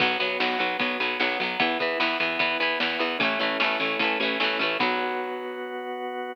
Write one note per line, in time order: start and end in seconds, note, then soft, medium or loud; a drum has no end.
0.00 0.17 B1 loud
0.00 0.18 F#3 loud
0.00 0.18 B3 medium
0.00 1.43 B3 loud
0.00 1.43 F#4 loud
0.00 kick loud
0.00 crash loud
0.20 0.37 B1 medium
0.20 0.38 F#3 medium
0.20 0.38 B3 medium
0.20 ride medium
0.40 0.57 B1 medium
0.40 0.59 F#3 medium
0.40 0.58 B3 medium
0.40 snare loud
0.59 0.77 B1 medium
0.59 0.77 F#3 medium
0.59 0.77 B3 medium
0.59 ride medium
0.79 0.97 B1 medium
0.79 0.98 F#3 medium
0.79 0.98 B3 medium
0.79 kick loud
0.79 ride loud
1.00 1.17 B1 medium
1.00 1.18 F#3 medium
1.00 1.18 B3 medium
1.00 ride medium
1.20 1.37 B1 medium
1.20 1.39 F#3 medium
1.20 1.39 B3 medium
1.20 snare loud
1.40 1.57 B1 medium
1.40 1.60 F#3 medium
1.40 1.59 B3 medium
1.40 ride medium
1.59 1.77 E2 medium
1.59 1.78 E3 medium
1.59 3.03 B3 loud
1.59 1.78 B3 loud
1.59 3.03 E4 loud
1.59 kick loud
1.59 ride loud
1.79 1.97 E2 medium
1.79 1.99 E3 medium
1.79 1.99 B3 medium
1.79 kick loud
1.79 ride medium
2.00 2.17 E2 medium
2.00 2.18 E3 medium
2.00 2.18 B3 medium
2.00 snare loud
2.20 2.37 E2 medium
2.20 2.39 E3 medium
2.20 2.39 B3 medium
2.20 ride medium
2.39 2.57 E2 medium
2.39 2.58 E3 medium
2.39 2.58 B3 medium
2.39 kick loud
2.39 ride loud
2.60 2.77 E2 medium
2.60 2.79 E3 medium
2.60 2.79 B3 medium
2.60 ride medium
2.80 2.97 E2 medium
2.80 2.99 E3 medium
2.80 2.99 B3 medium
2.80 snare loud
2.99 3.17 E2 medium
2.99 3.18 E3 medium
2.99 3.18 B3 medium
2.99 ride medium
3.19 3.37 A1 loud
3.19 4.63 A3 loud
3.19 4.63 C#4 loud
3.19 3.39 C#4 medium
3.19 4.63 E4 loud
3.19 kick loud
3.19 ride loud
3.23 3.39 E3 medium
3.23 3.39 A3 medium
3.39 3.57 A1 medium
3.39 3.58 E3 medium
3.39 3.58 A3 medium
3.39 3.58 C#4 medium
3.39 ride medium
3.60 3.77 A1 medium
3.60 3.78 E3 medium
3.60 3.78 A3 medium
3.60 3.78 C#4 medium
3.60 snare loud
3.80 3.97 A1 medium
3.80 3.98 E3 medium
3.80 3.98 A3 medium
3.80 3.98 C#4 medium
3.80 ride medium
3.99 4.17 A1 medium
3.99 4.18 A3 medium
3.99 4.18 C#4 medium
3.99 kick loud
3.99 ride loud
4.04 4.18 E3 medium
4.20 4.37 A1 medium
4.20 4.39 A3 medium
4.20 4.39 C#4 medium
4.20 ride medium
4.24 4.39 E3 medium
4.40 4.57 A1 medium
4.40 4.58 E3 medium
4.40 4.58 A3 medium
4.40 4.58 C#4 medium
4.40 snare loud
4.59 4.77 A1 medium
4.59 4.78 E3 medium
4.59 4.78 A3 medium
4.59 4.78 C#4 medium
4.59 ride medium
4.79 6.33 B1 loud
4.79 6.34 F#3 loud
4.79 6.33 B3 loud
4.79 6.34 B3 loud
4.79 6.33 F#4 loud
4.79 kick loud
4.79 crash loud